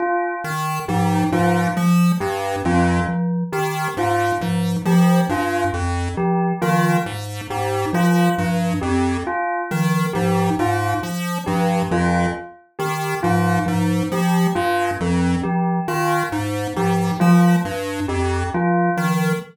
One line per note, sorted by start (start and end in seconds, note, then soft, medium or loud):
0.00 0.35 F4 medium
0.44 0.80 D#3 medium
0.88 1.24 G#2 medium
0.88 1.25 F3 medium
0.88 1.24 G4 medium
1.32 1.67 G#2 medium
1.32 1.69 F3 medium
1.32 1.68 F4 medium
1.77 2.12 F3 medium
2.20 2.56 G2 medium
2.20 2.56 G4 medium
2.65 3.00 F2 medium
2.65 3.01 F3 medium
2.65 3.01 F4 medium
3.08 3.44 F3 medium
3.52 3.88 D#3 medium
3.52 3.88 G4 medium
3.97 4.32 G#2 medium
3.97 4.34 F4 medium
4.41 4.76 G#2 medium
4.41 4.78 F3 medium
4.85 5.21 F3 medium
4.85 5.23 F3 medium
4.85 5.22 G4 medium
5.29 5.65 G2 medium
5.29 5.66 F4 medium
5.74 6.09 F2 medium
6.17 6.53 F3 medium
6.17 6.53 G4 medium
6.62 6.97 D#3 medium
6.62 6.99 F3 medium
6.62 6.97 F4 medium
7.06 7.41 G#2 medium
7.50 7.85 G#2 medium
7.50 7.85 G4 medium
7.93 8.28 F3 medium
7.93 8.29 F3 medium
7.93 8.30 F4 medium
8.38 8.74 G2 medium
8.38 8.74 F3 medium
8.81 9.18 F2 medium
8.81 9.17 G4 medium
9.27 9.62 F4 medium
9.71 10.06 D#3 medium
9.71 10.06 F3 medium
10.13 10.50 G#2 medium
10.13 10.51 F3 medium
10.13 10.49 G4 medium
10.59 10.94 G#2 medium
10.59 10.95 F4 medium
11.03 11.38 F3 medium
11.46 11.82 G2 medium
11.46 11.83 F3 medium
11.46 11.82 G4 medium
11.91 12.26 F2 medium
11.91 12.26 F3 medium
11.91 12.27 F4 medium
12.79 13.15 D#3 medium
12.79 13.14 G4 medium
13.23 13.59 G#2 medium
13.23 13.59 F3 medium
13.23 13.58 F4 medium
13.66 14.03 G#2 medium
13.66 14.01 F3 medium
14.12 14.47 F3 medium
14.12 14.48 G4 medium
14.55 14.91 G2 medium
14.55 14.91 F4 medium
15.00 15.36 F2 medium
15.00 15.36 F3 medium
15.43 15.80 F3 medium
15.43 15.79 G4 medium
15.88 16.23 D#3 medium
15.88 16.23 F4 medium
16.32 16.67 G#2 medium
16.76 17.11 G#2 medium
16.76 17.13 F3 medium
16.76 17.12 G4 medium
17.20 17.56 F3 medium
17.20 17.57 F3 medium
17.20 17.55 F4 medium
17.65 18.00 G2 medium
18.08 18.44 F2 medium
18.08 18.44 G4 medium
18.54 18.90 F3 medium
18.54 18.90 F4 medium
18.97 19.33 D#3 medium
18.97 19.33 F3 medium